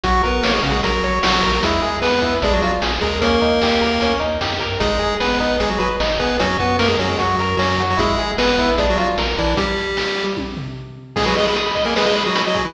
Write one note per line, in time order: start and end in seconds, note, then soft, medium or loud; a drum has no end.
0.03 0.21 A#1 loud
0.03 0.22 F#3 medium
0.03 0.22 F#4 medium
0.03 0.22 F#4 loud
0.03 kick loud
0.03 closed hi-hat medium
0.23 0.41 A#1 medium
0.23 0.44 B3 medium
0.23 0.41 A#4 medium
0.23 0.44 B4 medium
0.23 kick medium
0.23 closed hi-hat medium
0.43 0.60 A#1 medium
0.43 0.52 A#3 medium
0.43 0.52 A#4 medium
0.43 0.62 C#5 medium
0.43 snare loud
0.53 0.62 G#3 soft
0.53 0.62 G#4 medium
0.63 0.80 A#1 medium
0.63 0.72 C#3 medium
0.63 0.72 C#4 medium
0.63 0.81 F#4 medium
0.63 closed hi-hat medium
0.72 0.81 G#3 medium
0.72 0.81 G#4 medium
0.83 1.00 A#1 medium
0.83 1.19 F#3 medium
0.83 1.19 F#4 medium
0.83 1.02 A#4 medium
0.83 kick medium
0.83 closed hi-hat loud
1.03 1.20 A#1 medium
1.03 1.22 C#5 medium
1.03 closed hi-hat medium
1.23 1.40 A#1 medium
1.23 1.52 F#3 medium
1.23 1.40 F#4 medium
1.23 1.52 F#4 medium
1.23 snare loud
1.43 1.60 A#1 medium
1.43 1.61 A#4 medium
1.43 kick medium
1.43 open hi-hat medium
1.52 1.62 F#3 medium
1.52 1.62 F#4 medium
1.63 1.80 E2 loud
1.63 1.97 G#3 medium
1.63 1.81 E4 medium
1.63 1.97 G#4 medium
1.63 kick medium
1.63 closed hi-hat loud
1.82 2.00 E2 medium
1.82 2.00 G#4 medium
1.82 closed hi-hat medium
2.01 2.19 E2 medium
2.01 2.34 B3 medium
2.01 2.34 B4 medium
2.01 2.20 B4 medium
2.01 snare medium
2.22 2.39 E2 medium
2.22 2.40 E4 medium
2.22 kick medium
2.22 closed hi-hat medium
2.42 2.59 A#1 loud
2.42 2.53 G#3 medium
2.42 2.61 D4 loud
2.42 2.53 G#4 medium
2.42 kick medium
2.42 closed hi-hat medium
2.53 2.62 F#3 medium
2.53 2.62 F#4 medium
2.62 2.79 A#1 medium
2.62 2.72 F#3 medium
2.62 2.80 F4 medium
2.62 2.72 F#4 medium
2.62 closed hi-hat medium
2.82 2.99 A#1 loud
2.82 3.00 G#4 medium
2.82 snare loud
3.01 3.39 D#2 loud
3.01 3.19 G#3 medium
3.01 3.19 G#4 medium
3.01 3.20 A#4 medium
3.01 kick medium
3.01 closed hi-hat medium
3.21 4.13 A#3 medium
3.21 3.40 C#4 medium
3.21 4.13 A#4 medium
3.21 kick medium
3.21 closed hi-hat loud
3.41 3.59 D#2 medium
3.41 3.59 D#4 medium
3.41 kick medium
3.41 closed hi-hat medium
3.62 3.78 D#2 medium
3.62 3.81 G4 medium
3.62 snare loud
3.81 3.98 D#2 medium
3.81 3.99 A#4 medium
3.81 closed hi-hat medium
4.01 4.18 D#2 medium
4.01 4.19 C#4 medium
4.01 kick medium
4.01 closed hi-hat medium
4.20 4.38 D#2 medium
4.20 4.38 D#4 medium
4.20 closed hi-hat medium
4.41 4.59 F#2 medium
4.41 4.59 G4 medium
4.41 snare medium
4.60 4.79 G2 medium
4.60 4.78 A#4 medium
4.60 kick medium
4.60 closed hi-hat medium
4.80 4.98 G#1 loud
4.80 5.15 G#3 medium
4.80 4.98 D#4 loud
4.80 5.15 G#4 medium
4.80 kick loud
4.80 closed hi-hat medium
4.99 5.17 G#1 medium
4.99 5.17 G#4 medium
4.99 closed hi-hat medium
5.20 5.37 G#1 medium
5.20 5.57 B3 medium
5.20 5.38 B4 medium
5.20 5.57 B4 medium
5.20 snare medium
5.40 5.57 G#1 medium
5.40 5.58 D#4 medium
5.40 kick medium
5.40 closed hi-hat medium
5.60 5.77 G#1 medium
5.60 5.69 G#3 medium
5.60 5.69 G#4 medium
5.60 5.78 G#4 medium
5.60 kick medium
5.60 closed hi-hat medium
5.69 5.78 F#3 medium
5.69 5.78 F#4 medium
5.78 5.97 G#1 medium
5.78 5.89 F#3 medium
5.78 5.89 F#4 medium
5.78 5.96 B4 medium
5.78 closed hi-hat medium
6.00 6.17 G#1 loud
6.00 6.18 D#4 medium
6.00 snare loud
6.19 6.37 G#1 medium
6.19 6.37 B3 medium
6.19 6.37 G#4 medium
6.19 6.37 B4 medium
6.19 kick medium
6.19 closed hi-hat medium
6.39 6.57 F#2 loud
6.39 6.57 F#3 medium
6.39 6.57 C#4 medium
6.39 6.57 F#4 medium
6.39 kick medium
6.39 closed hi-hat loud
6.59 6.76 F#2 medium
6.59 6.77 B3 medium
6.59 6.77 F#4 medium
6.59 6.77 B4 medium
6.59 kick medium
6.59 closed hi-hat medium
6.79 6.96 F#2 loud
6.79 6.88 A#3 medium
6.79 6.97 A#4 medium
6.79 6.88 A#4 medium
6.79 snare medium
6.88 6.97 G#3 medium
6.88 6.97 G#4 medium
6.99 7.16 F#2 medium
6.99 7.09 F#3 medium
6.99 7.17 C#4 medium
6.99 7.09 F#4 medium
6.99 closed hi-hat medium
7.09 7.18 G#3 medium
7.09 7.18 G#4 medium
7.18 7.36 F#2 medium
7.18 7.56 F#3 soft
7.18 7.36 F#4 medium
7.18 7.56 F#4 medium
7.18 kick medium
7.18 closed hi-hat medium
7.39 7.56 F#2 loud
7.39 7.58 A#4 medium
7.39 closed hi-hat medium
7.57 7.75 F#2 medium
7.57 7.82 F#3 medium
7.57 7.76 C#4 medium
7.57 7.82 F#4 medium
7.57 snare medium
7.78 7.95 F#2 loud
7.78 7.98 F#4 medium
7.78 closed hi-hat medium
7.90 8.00 F#3 medium
7.90 8.00 F#4 medium
7.97 8.15 G#1 medium
7.97 8.31 G#3 medium
7.97 8.15 E4 medium
7.97 8.31 G#4 medium
7.97 kick loud
7.97 closed hi-hat medium
8.18 8.35 G#1 medium
8.18 8.37 G#4 medium
8.18 closed hi-hat medium
8.38 8.55 G#1 loud
8.38 8.70 B3 medium
8.38 8.70 B4 medium
8.38 8.56 B4 medium
8.38 snare loud
8.58 8.75 G#1 loud
8.58 8.76 E4 medium
8.58 kick medium
8.58 closed hi-hat medium
8.78 8.95 A#1 loud
8.78 8.87 G#3 medium
8.78 8.96 D4 loud
8.78 8.87 G#4 medium
8.78 kick medium
8.78 closed hi-hat medium
8.90 8.98 F#3 medium
8.90 8.98 F#4 medium
8.97 9.15 A#1 medium
8.97 9.08 F#3 medium
8.97 9.15 F4 medium
8.97 9.08 F#4 medium
8.97 closed hi-hat medium
9.18 9.35 A#1 medium
9.18 9.36 A#4 medium
9.18 snare medium
9.38 9.54 A#1 medium
9.38 9.54 E3 medium
9.38 9.56 D4 medium
9.38 9.54 E4 medium
9.38 kick medium
9.38 closed hi-hat medium
9.57 10.24 G3 medium
9.57 10.24 G4 medium
9.57 kick loud
9.57 closed hi-hat medium
9.77 closed hi-hat medium
9.97 snare medium
10.17 closed hi-hat medium
10.37 kick medium
10.37 high tom medium
10.57 floor tom medium
11.16 11.26 G#3 medium
11.16 11.25 G#4 loud
11.16 11.26 G#4 medium
11.16 kick loud
11.16 crash loud
11.26 11.35 F#3 medium
11.26 11.35 F#4 medium
11.26 11.35 B4 medium
11.36 11.47 G#3 medium
11.36 11.47 G#4 medium
11.36 11.45 D#5 medium
11.36 closed hi-hat medium
11.45 11.57 G#3 medium
11.45 11.57 G#4 medium
11.45 11.54 B5 medium
11.56 11.65 D#6 medium
11.56 closed hi-hat medium
11.66 11.75 B5 medium
11.75 11.84 D#5 medium
11.75 kick medium
11.75 closed hi-hat medium
11.85 11.94 A#3 medium
11.85 11.95 G#4 medium
11.85 11.94 A#4 medium
11.96 12.05 G#3 medium
11.96 12.05 G#4 medium
11.96 12.05 B4 medium
11.96 snare loud
12.06 12.23 G#3 medium
12.06 12.23 G#4 medium
12.06 12.15 D#5 medium
12.15 12.24 B5 medium
12.15 closed hi-hat medium
12.25 12.42 F#3 medium
12.25 12.42 F#4 medium
12.25 12.34 D#6 medium
12.35 12.44 B5 medium
12.35 closed hi-hat loud
12.46 12.66 F#3 medium
12.46 12.66 F#4 medium
12.46 12.55 D#5 medium
12.54 12.63 G#4 medium
12.54 kick medium
12.54 closed hi-hat medium
12.64 12.74 E3 medium
12.64 12.74 E4 medium
12.64 12.74 B4 medium